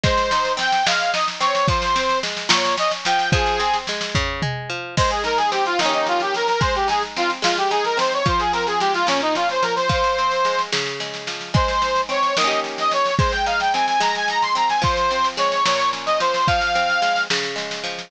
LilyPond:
<<
  \new Staff \with { instrumentName = "Accordion" } { \time 6/8 \key aes \major \tempo 4. = 73 c''4 g''8 f''8 ees''16 r16 des''8 | c''4 r8 des''8 ees''16 r16 g''8 | aes'4 r2 | c''16 aes'16 bes'16 aes'16 g'16 f'16 ees'16 ees'16 f'16 g'16 bes'16 bes'16 |
c''16 g'16 aes'16 r16 f'16 r16 f'16 g'16 aes'16 bes'16 c''16 des''16 | c''16 aes'16 bes'16 aes'16 g'16 f'16 des'16 ees'16 f'16 c''16 bes'16 c''16 | c''4. r4. | c''4 des''8 ees''8 r16 ees''16 des''8 |
c''16 g''16 f''16 g''16 aes''16 aes''16 bes''16 aes''16 bes''16 c'''16 bes''16 aes''16 | c''4 des''8 des''8 r16 ees''16 c''8 | f''4. r4. | }
  \new Staff \with { instrumentName = "Pizzicato Strings" } { \time 6/8 \key aes \major aes8 ees'8 c'8 aes8 ees'8 c'8 | f8 c'8 aes8 bes,8 des'8 f8 | f8 c'8 aes8 des8 aes8 f8 | aes8 ees'8 c'8 <ees bes des' g'>4. |
aes8 ees'8 c'8 aes8 ees'8 c'8 | f8 c'8 aes8 bes,8 des'8 f8 | f8 c'8 aes8 des8 aes8 f8 | aes8 ees'8 c'8 <ees bes des' g'>4. |
aes8 ees'8 c'8 aes8 ees'8 c'8 | f8 c'8 aes8 bes,8 des'8 f8 | f8 c'8 aes8 des8 aes8 f8 | }
  \new DrumStaff \with { instrumentName = "Drums" } \drummode { \time 6/8 <bd sn>16 sn16 sn16 sn16 sn16 sn16 sn16 sn16 sn16 sn16 sn16 sn16 | <bd sn>16 sn16 sn16 sn16 sn16 sn16 sn16 sn16 sn16 sn16 sn16 sn16 | <bd sn>16 sn16 sn16 sn16 sn16 sn16 <bd tomfh>8 toml4 | <cymc bd sn>16 sn16 sn16 sn16 sn16 sn16 sn16 sn16 sn16 sn16 sn16 sn16 |
<bd sn>16 sn16 sn16 sn16 sn16 sn16 sn16 sn16 sn16 sn16 sn16 sn16 | <bd sn>16 sn16 sn16 sn16 sn16 sn16 sn16 sn16 sn16 sn16 sn16 sn16 | <bd sn>16 sn16 sn16 sn16 sn16 sn16 sn16 sn16 sn16 sn16 sn16 sn16 | <bd sn>16 sn16 sn16 sn16 sn16 sn16 sn16 sn16 sn16 sn16 sn16 sn16 |
<bd sn>16 sn16 sn16 sn16 sn16 sn16 sn16 sn16 sn16 sn16 sn16 sn16 | <bd sn>16 sn16 sn16 sn16 sn16 sn16 sn16 sn16 sn16 sn16 sn16 sn16 | <bd sn>16 sn16 sn16 sn16 sn16 sn16 sn16 sn16 sn16 sn16 sn16 sn16 | }
>>